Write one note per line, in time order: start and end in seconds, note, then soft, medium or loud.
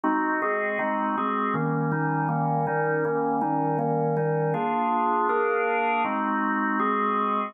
0.04 0.41 G#3 medium
0.04 0.41 C4 medium
0.04 0.41 D#4 medium
0.04 0.41 F#4 medium
0.42 0.78 G#3 medium
0.42 0.78 C4 medium
0.42 0.78 F#4 medium
0.42 0.79 G#4 medium
0.79 1.16 G#3 medium
0.79 1.16 C4 medium
0.79 1.16 D#4 medium
0.79 1.16 F#4 medium
1.17 1.55 G#3 medium
1.17 1.55 C4 medium
1.17 1.55 F#4 medium
1.17 1.55 G#4 medium
1.54 1.91 D#3 medium
1.54 1.91 G3 medium
1.54 1.91 A#3 medium
1.54 1.91 C#4 medium
1.92 2.28 D#3 medium
1.92 2.28 G3 medium
1.92 2.28 C#4 medium
1.92 2.29 D#4 medium
2.29 2.66 D#3 medium
2.29 2.66 G3 medium
2.29 2.66 A#3 medium
2.29 2.66 C#4 medium
2.67 3.04 D#3 medium
2.67 3.04 G3 medium
2.67 3.04 C#4 medium
2.67 3.04 D#4 medium
3.05 3.41 D#3 medium
3.05 3.41 G3 medium
3.05 3.42 A#3 medium
3.05 3.41 C#4 medium
3.41 3.78 D#3 medium
3.41 3.78 G3 medium
3.41 3.78 C#4 medium
3.41 3.78 D#4 medium
3.79 4.16 D#3 medium
3.79 4.16 G3 medium
3.79 4.16 A#3 medium
3.79 4.16 C#4 medium
4.17 4.54 D#3 medium
4.17 4.54 G3 medium
4.17 4.54 C#4 medium
4.17 4.54 D#4 medium
4.54 5.28 A#3 medium
4.54 5.28 D4 medium
4.54 5.28 F4 medium
4.54 5.28 G#4 medium
5.29 6.03 A#3 medium
5.29 6.03 D4 medium
5.29 6.03 G#4 medium
5.29 6.03 A#4 medium
6.04 6.79 G#3 medium
6.04 6.79 C4 medium
6.04 6.79 D#4 medium
6.04 6.79 F#4 medium
6.79 7.54 G#3 medium
6.79 7.54 C4 medium
6.79 7.54 F#4 medium
6.79 7.54 G#4 medium